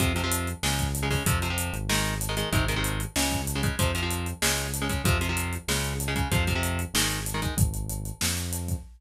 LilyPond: <<
  \new Staff \with { instrumentName = "Overdriven Guitar" } { \clef bass \time 4/4 \key f \phrygian \tempo 4 = 190 <c f>8 <c f>16 <c f>4~ <c f>16 <des aes>4~ <des aes>16 <des aes>16 <des aes>8 | <c f>8 <c f>16 <c f>4~ <c f>16 <ees aes>4~ <ees aes>16 <ees aes>16 <ees aes>8 | <c ees aes>8 <c ees aes>16 <c ees aes>4~ <c ees aes>16 <des aes>4~ <des aes>16 <des aes>16 <des aes>8 | <c f>8 <c f>16 <c f>4~ <c f>16 <des aes>4~ <des aes>16 <des aes>16 <des aes>8 |
<c f>8 <c f>16 <c f>4~ <c f>16 <des aes>4~ <des aes>16 <des aes>16 <des aes>8 | <c f>8 <c f>16 <c f>4~ <c f>16 <ees aes>4~ <ees aes>16 <ees aes>16 <ees aes>8 | r1 | }
  \new Staff \with { instrumentName = "Synth Bass 1" } { \clef bass \time 4/4 \key f \phrygian f,2 des,2 | f,4. aes,,2~ aes,,8 | aes,,2 des,2 | f,2 des,2 |
f,2 des,2 | f,2 aes,,2 | aes,,2 f,2 | }
  \new DrumStaff \with { instrumentName = "Drums" } \drummode { \time 4/4 <hh bd>8 hh8 hh8 hh8 sn8 <hh bd>8 hh8 <hho bd>8 | <hh bd>8 hh8 hh8 hh8 sn8 hh8 hh8 hh8 | <hh bd>8 hh8 hh8 hh8 sn8 <hh bd>8 hh8 <hh bd>8 | <hh bd>8 hh8 hh8 hh8 sn8 hh8 hh8 <hh bd>8 |
<hh bd>8 hh8 hh8 hh8 sn8 hh8 hh8 <hh bd>8 | <hh bd>8 <hh bd>8 hh8 hh8 sn8 hh8 hh8 <hh bd>8 | <hh bd>8 hh8 hh8 hh8 sn8 hh8 hh8 <hh bd>8 | }
>>